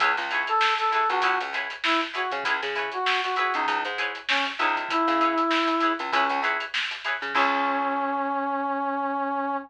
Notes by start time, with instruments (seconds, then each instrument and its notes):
0.00 electric bass (finger) C#2, acoustic guitar (steel) E4 G#4 B4 C#5, kick, closed hi-hat
0.17 electric bass (finger) C#2, snare, closed hi-hat
0.31 acoustic guitar (steel) E4 G#4 B4 C#5, snare, closed hi-hat
0.47 brass section A4, closed hi-hat
0.61 snare
0.78 brass section A4, closed hi-hat
0.92 acoustic guitar (steel) E4 G#4 B4 C#5, brass section A4, snare, closed hi-hat
1.09 electric bass (finger) C#2, brass section F#4, snare, closed hi-hat
1.22 electric bass (finger) C#2, acoustic guitar (steel) E4 G#4 B4 C#5, kick, closed hi-hat
1.40 electric bass (finger) C#2, closed hi-hat
1.53 acoustic guitar (steel) E4 G#4 B4 C#5, snare, closed hi-hat
1.70 closed hi-hat
1.84 brass section E4, snare
2.01 closed hi-hat
2.14 acoustic guitar (steel) E4 G#4 B4 C#5, brass section F#4, closed hi-hat
2.31 electric bass (finger) C#3, kick, closed hi-hat
2.44 electric bass (finger) C#2, acoustic guitar (steel) E4 G#4 B4, kick, closed hi-hat
2.48 acoustic guitar (steel) C#5
2.63 electric bass (finger) C#3, snare, closed hi-hat
2.75 acoustic guitar (steel) E4 G#4 B4 C#5, kick, closed hi-hat
2.92 brass section F#4, closed hi-hat
3.06 snare
3.23 brass section F#4, snare, closed hi-hat
3.36 acoustic guitar (steel) E4 G#4 B4 C#5, brass section F#4, closed hi-hat
3.54 electric bass (finger) C#2, brass section D#4, closed hi-hat
3.67 electric bass (finger) C#2, kick, closed hi-hat
3.85 electric bass (finger) G#2, closed hi-hat
3.98 acoustic guitar (steel) E4 G#4 B4 C#5, closed hi-hat
4.15 closed hi-hat
4.29 brass section C#4, snare
4.46 closed hi-hat
4.59 electric bass (finger) C#2, brass section D#4, acoustic guitar (steel) E4 G#4 B4 C#5, snare, closed hi-hat
4.76 kick, closed hi-hat
4.89 brass section E4, kick, closed hi-hat
5.07 electric bass (finger) C#3, snare, closed hi-hat
5.20 acoustic guitar (steel) E4 G#4 B4 C#5, kick, closed hi-hat
5.38 closed hi-hat
5.51 snare
5.68 closed hi-hat
5.80 acoustic guitar (steel) E4 G#4 B4, closed hi-hat
5.85 acoustic guitar (steel) C#5
5.99 electric bass (finger) C#2, closed hi-hat
6.12 electric bass (finger) C#2, brass section C#4, acoustic guitar (steel) E4 G#4 B4 C#5, kick, closed hi-hat
6.29 electric bass (finger) C#2, closed hi-hat
6.43 acoustic guitar (steel) E4 G#4 B4 C#5, closed hi-hat
6.60 closed hi-hat
6.74 snare
6.91 closed hi-hat
7.04 acoustic guitar (steel) E4 G#4 B4 C#5, closed hi-hat
7.21 electric bass (finger) C#3, snare, closed hi-hat
7.34 electric bass (finger) C#2, brass section C#4, acoustic guitar (steel) E4 G#4 B4 C#5, kick, crash